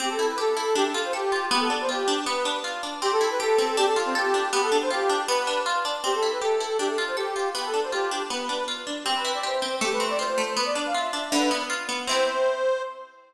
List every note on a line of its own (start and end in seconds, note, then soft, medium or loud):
0.00 0.17 C4 loud
0.00 0.09 G4 medium
0.09 0.27 A4 medium
0.19 0.36 E4 medium
0.30 0.39 B4 medium
0.38 0.55 G4 medium
0.38 0.75 A4 medium
0.57 0.74 E4 medium
0.75 0.92 D4 loud
0.75 0.84 G4 medium
0.85 1.01 A4 medium
0.94 1.11 F4 medium
1.04 1.13 C5 medium
1.13 1.46 G4 medium
1.13 1.30 A4 medium
1.32 1.49 F4 medium
1.51 1.68 B3 loud
1.51 1.60 G4 medium
1.60 1.75 A4 medium
1.70 1.87 D4 medium
1.81 1.90 C5 medium
1.89 2.06 F4 medium
1.89 2.21 G4 medium
2.08 2.25 D4 loud
2.25 2.43 B3 loud
2.25 2.59 B4 medium
2.45 2.62 D4 medium
2.64 2.81 F4 medium
2.83 3.00 D4 medium
3.02 3.58 C4 loud
3.02 3.11 G4 loud
3.12 3.29 A4 medium
3.21 3.75 E4 medium
3.30 3.39 B4 medium
3.40 3.76 G4 loud
3.40 3.76 A4 medium
3.58 3.76 C4 medium
3.77 4.33 D4 loud
3.77 3.86 G4 loud
3.86 4.02 A4 medium
3.96 4.50 F4 medium
4.06 4.14 C4 medium
4.15 4.48 G4 medium
4.15 4.51 A4 loud
4.34 4.52 D4 medium
4.52 4.70 B3 loud
4.52 4.61 G4 medium
4.61 4.77 A4 medium
4.72 4.89 D4 medium
4.82 4.91 C5 medium
4.90 5.07 F4 medium
4.90 5.22 G4 medium
5.10 5.26 D4 medium
5.27 5.45 B3 loud
5.27 5.61 B4 loud
5.47 5.64 D4 medium
5.66 5.83 F4 medium
5.85 6.02 D4 medium
6.04 6.21 C4 medium
6.04 6.14 G4 medium
6.14 6.31 A4 medium
6.23 6.40 E4 medium
6.32 6.41 B4 medium
6.42 6.58 G4 medium
6.42 6.77 A4 medium
6.60 6.77 E4 medium
6.79 6.96 D4 medium
6.79 6.88 G4 medium
6.88 7.04 A4 medium
6.98 7.15 F4 medium
7.07 7.16 C5 medium
7.17 7.49 G4 medium
7.17 7.34 A4 medium
7.36 7.53 F4 medium
7.55 7.72 B3 loud
7.55 7.65 G4 medium
7.65 7.81 A4 medium
7.74 7.91 D4 medium
7.83 7.92 C5 medium
7.92 8.09 F4 medium
7.92 8.23 G4 medium
8.11 8.28 D4 medium
8.30 8.47 B3 medium
8.30 8.64 B4 medium
8.49 8.66 D4 medium
8.68 8.85 F4 medium
8.87 9.04 D4 medium
9.04 9.62 C4 loud
9.04 9.13 G4 medium
9.15 9.33 B4 medium
9.25 9.78 E4 medium
9.34 9.43 D5 medium
9.43 9.79 G4 medium
9.43 9.75 C5 medium
9.62 9.80 C4 medium
9.81 10.37 A3 loud
9.81 9.91 G4 medium
9.92 10.10 B4 medium
10.00 10.54 C4 medium
10.10 10.19 D5 medium
10.19 10.55 F4 medium
10.19 10.53 C5 medium
10.38 10.56 A3 medium
10.56 10.74 B3 loud
10.56 10.65 B4 medium
10.65 10.82 D5 medium
10.75 10.92 D4 medium
10.86 10.95 F5 medium
10.94 11.11 F4 medium
10.94 11.30 E5 medium
11.13 11.30 D4 medium
11.32 11.49 D3 loud
11.32 11.63 B4 medium
11.51 11.68 B3 medium
11.70 11.87 F4 medium
11.89 12.06 B3 loud
12.07 12.83 C4 loud
12.07 12.83 E4 loud
12.07 12.82 C5 loud
12.11 12.83 G4 medium